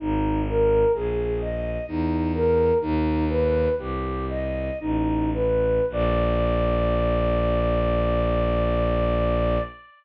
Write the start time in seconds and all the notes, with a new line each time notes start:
0.00 G#1 D#4
0.48 A#4
0.94 A#1 G#4
1.41 D#5
1.88 E2 D#4
2.35 A#4
2.81 D#2 D#4
3.29 B4
3.78 C2 G4
4.29 D#5
4.80 A1 D#4
5.34 B4
5.90 A#1 D5